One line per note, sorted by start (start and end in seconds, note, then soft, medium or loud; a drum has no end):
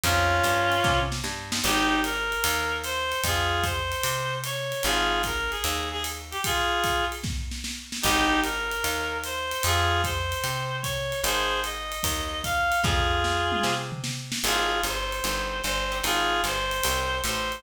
0.04 0.41 F2 loud
0.04 0.37 C4 medium
0.04 1.00 C#4 loud
0.04 0.37 D#4 loud
0.04 1.00 F4 loud
0.04 0.37 F4 loud
0.04 0.37 G#4 medium
0.04 kick medium
0.04 ride loud
0.44 0.81 G2 medium
0.44 hi-hat pedal medium
0.44 ride medium
0.72 ride medium
0.84 1.22 C3 medium
0.84 kick medium
0.84 snare medium
1.12 snare medium
1.24 1.61 G2 medium
1.24 snare medium
1.52 1.60 C4 medium
1.52 1.60 D#4 medium
1.52 1.60 F4 medium
1.52 1.60 G#4 medium
1.52 snare loud
1.64 2.35 G#1 loud
1.64 2.00 D#4 loud
1.64 2.00 G4 loud
1.64 crash medium
1.64 ride medium
2.04 2.78 A#4 loud
2.04 hi-hat pedal medium
2.04 ride medium
2.32 ride medium
2.44 3.14 D#2 medium
2.44 ride loud
2.84 3.21 C5 loud
2.84 hi-hat pedal medium
2.84 ride medium
3.12 ride medium
3.24 3.94 F2 medium
3.24 3.65 F4 loud
3.24 3.65 G#4 loud
3.24 kick medium
3.24 ride loud
3.63 4.36 C5 loud
3.63 kick medium
3.63 hi-hat pedal medium
3.63 ride medium
3.92 ride medium
4.04 4.74 C3 medium
4.04 ride loud
4.44 4.83 C#5 loud
4.44 hi-hat pedal medium
4.44 ride medium
4.72 ride medium
4.83 5.55 G#1 loud
4.83 5.22 F4 loud
4.83 5.22 G#4 loud
4.83 ride medium
5.23 5.51 A#4 loud
5.23 kick medium
5.23 hi-hat pedal medium
5.23 ride medium
5.51 5.89 G#4 medium
5.51 ride medium
5.64 6.35 D#2 loud
5.64 ride loud
5.92 6.03 G#4 loud
6.04 hi-hat pedal medium
6.04 ride medium
6.31 6.41 G4 loud
6.31 ride medium
6.44 7.05 F4 loud
6.44 7.05 G#4 loud
6.44 kick medium
6.44 ride loud
6.84 kick medium
6.84 hi-hat pedal medium
6.84 ride medium
7.12 ride medium
7.24 kick medium
7.24 snare medium
7.51 snare medium
7.64 snare medium
7.92 snare medium
8.02 8.75 G#1 loud
8.02 8.40 D#4 loud
8.02 8.40 G4 loud
8.02 kick medium
8.02 crash loud
8.02 ride loud
8.43 9.18 A#4 medium
8.43 hi-hat pedal medium
8.43 ride medium
8.71 ride medium
8.84 9.54 D#2 medium
8.84 ride medium
9.24 9.63 C5 loud
9.24 hi-hat pedal medium
9.24 ride medium
9.52 ride medium
9.63 10.34 F2 loud
9.63 10.02 F4 loud
9.63 10.02 G#4 loud
9.63 ride loud
10.04 10.77 C5 medium
10.04 kick medium
10.04 hi-hat pedal medium
10.04 ride medium
10.32 ride medium
10.44 11.14 C3 medium
10.44 ride medium
10.82 11.21 C#5 loud
10.82 kick medium
10.82 hi-hat pedal medium
10.82 ride medium
11.12 ride medium
11.24 11.94 G#1 loud
11.24 11.60 G#4 loud
11.24 11.60 C5 loud
11.24 ride loud
11.64 12.42 D#5 medium
11.64 hi-hat pedal medium
11.64 ride medium
11.92 ride medium
12.03 12.74 D#2 medium
12.03 kick medium
12.03 ride loud
12.44 12.81 F5 loud
12.44 kick medium
12.44 hi-hat pedal medium
12.44 ride medium
12.72 ride medium
12.83 13.54 F2 medium
12.83 13.74 F4 loud
12.83 13.74 G#4 loud
12.83 kick medium
12.83 snare medium
13.24 snare medium
13.52 mid tom medium
13.63 14.34 C3 medium
13.63 snare medium
13.92 floor tom medium
14.04 snare medium
14.32 snare loud
14.44 14.81 G#1 loud
14.44 14.77 C4 medium
14.44 14.77 D#4 medium
14.44 14.81 F4 loud
14.44 14.77 G4 medium
14.44 14.81 G#4 loud
14.44 14.77 G#4 loud
14.44 crash medium
14.44 ride medium
14.83 15.21 G1 medium
14.83 15.61 C5 medium
14.83 hi-hat pedal medium
14.83 ride medium
15.12 ride medium
15.24 15.62 G1 medium
15.24 15.57 C4 medium
15.24 15.57 D#4 medium
15.24 15.57 G4 medium
15.24 15.57 G#4 medium
15.24 ride medium
15.62 16.02 G1 medium
15.62 15.99 C5 loud
15.62 hi-hat pedal medium
15.62 ride medium
15.92 16.00 C4 medium
15.92 16.00 D#4 medium
15.92 16.00 G4 medium
15.92 16.00 G#4 medium
15.92 ride medium
16.04 16.42 G#1 medium
16.04 16.36 C4 medium
16.04 16.36 C#4 medium
16.04 16.36 D#4 loud
16.04 16.36 F4 medium
16.04 16.42 F4 loud
16.04 16.42 G#4 loud
16.04 ride loud
16.44 16.81 G1 medium
16.44 17.19 C5 loud
16.44 hi-hat pedal medium
16.44 ride medium
16.71 ride medium
16.84 17.22 C2 medium
16.84 17.17 C4 medium
16.84 17.17 C#4 medium
16.84 17.17 D#4 medium
16.84 17.17 F4 medium
16.84 ride loud
17.24 17.62 A1 loud
17.24 17.61 C5 loud
17.24 hi-hat pedal medium
17.24 ride medium
17.52 ride medium